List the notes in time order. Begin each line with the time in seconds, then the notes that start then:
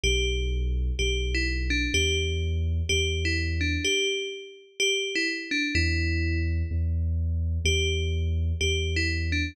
0.03 B1 G4
0.99 B1 G4
1.35 E4
1.70 D4
1.94 E2 G4
2.89 E2 G4
3.25 E4
3.61 D4
3.85 G4
4.80 G4
5.15 E4
5.51 D4
5.75 E2 E4
6.71 E2
7.65 E2 G4
8.61 E2 G4
8.96 E4
9.32 D4